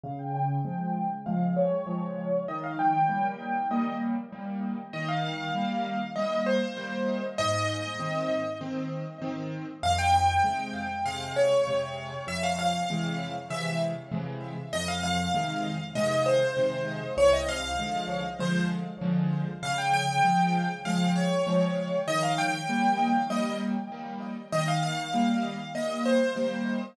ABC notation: X:1
M:4/4
L:1/16
Q:1/4=98
K:Fm
V:1 name="Acoustic Grand Piano"
f g g6 f2 d6 | e f g6 e2 z6 | e f f6 e2 c6 | e8 z8 |
f g g6 f2 d6 | =e f f6 e2 z6 | e f f6 e2 c6 | d e f6 c2 z6 |
f g g6 f2 d6 | e f g6 e2 z6 | e f f6 e2 c6 |]
V:2 name="Acoustic Grand Piano"
D,4 [F,A,]4 [F,A,]4 [F,A,]4 | E,4 [G,B,]4 [G,B,]4 [G,B,]4 | E,4 [G,B,]4 [G,B,]4 [G,B,]4 | A,,4 [E,C]4 [E,C]4 [E,C]4 |
F,,4 [C,A,]4 [C,A,]4 [C,A,]4 | F,,4 [C,=E,A,]4 [C,E,A,]4 [C,E,A,]4 | F,,4 [C,E,A,]4 [C,E,A,]4 [C,E,A,]4 | C,,4 [=D,F,A,]4 [D,F,A,]4 [D,F,A,]4 |
D,4 [F,A,]4 [F,A,]4 [F,A,]4 | E,4 [G,B,]4 [G,B,]4 [G,B,]4 | E,4 [G,B,]4 [G,B,]4 [G,B,]4 |]